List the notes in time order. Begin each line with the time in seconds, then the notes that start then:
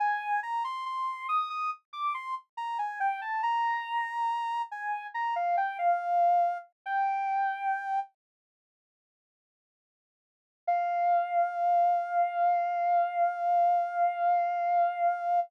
0.00 G#5
0.43 A#5
0.64 C6
0.86 C6
1.29 D#6
1.50 D#6
1.93 D6
2.14 C6
2.57 A#5
2.79 G#5
3.00 G5
3.21 A5
3.43 A#5
4.71 G#5
5.14 A#5
5.36 F5
5.57 G5
5.79 F5
6.86 G5
10.67 F5